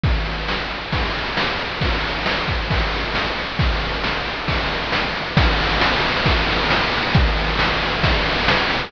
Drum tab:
CC |--------|--------|--------|x-------|
RD |xx-xxx-x|xx-xxx-x|xx-xxx-x|-x-xxx-x|
SD |--o---o-|--o---o-|--o---o-|--o---o-|
BD |o---o---|o--oo---|o---o---|o---o---|

CC |--------|
RD |xx-xxx-x|
SD |--o---o-|
BD |o---o---|